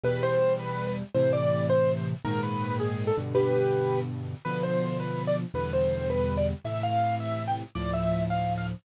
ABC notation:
X:1
M:6/8
L:1/16
Q:3/8=109
K:C
V:1 name="Acoustic Grand Piano"
B2 c4 B3 B z2 | c2 d4 c3 c z2 | _B2 =B4 _A3 =A z2 | [GB]8 z4 |
B2 c4 B3 d z2 | B2 c4 B3 d z2 | e2 f4 e3 g z2 | d2 e4 f3 f z2 |]
V:2 name="Acoustic Grand Piano" clef=bass
[E,,B,,G,]12 | [A,,C,E,]12 | [_A,,_B,,_E,]10 [G,,=B,,D,]2- | [G,,B,,D,]12 |
[B,,D,F,]12 | [E,,B,,D,G,]12 | [A,,C,E,]12 | [D,,A,,F,]12 |]